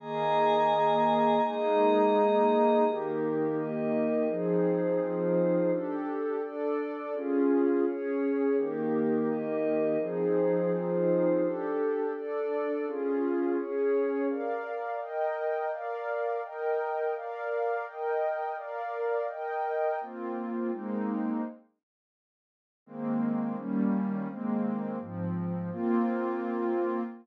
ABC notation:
X:1
M:6/8
L:1/8
Q:3/8=84
K:Ebmix
V:1 name="Pad 2 (warm)"
[E,B,A]6 | [A,B,E]6 | [E,B,G]6 | [F,CEA]6 |
[=DG=A]3 [DA=d]3 | [DFA]3 [DAd]3 | [E,B,G]6 | [F,CEA]6 |
[=DG=A]3 [DA=d]3 | [DFA]3 [DAd]3 | [K:Bbmix] [Bdf]3 [Beg]3 | [Bdf]3 [Beg]3 |
[Bdf]3 [Beg]3 | [Bdf]3 [Beg]3 | [B,CF]3 [A,B,CE]3 | z6 |
[E,A,B,C]3 [E,G,B,_D]3 | [E,A,B,C]3 [A,,F,C]3 | [B,CF]6 |]
V:2 name="Pad 5 (bowed)"
[eab]6 | [Aeb]6 | [EGB]3 [EBe]3 | [F,EAc]3 [F,EFc]3 |
[=DG=A]3 [DA=d]3 | [DFA]3 [DAd]3 | [EGB]3 [EBe]3 | [F,EAc]3 [F,EFc]3 |
[=DG=A]3 [DA=d]3 | [DFA]3 [DAd]3 | [K:Bbmix] z6 | z6 |
z6 | z6 | z6 | z6 |
z6 | z6 | z6 |]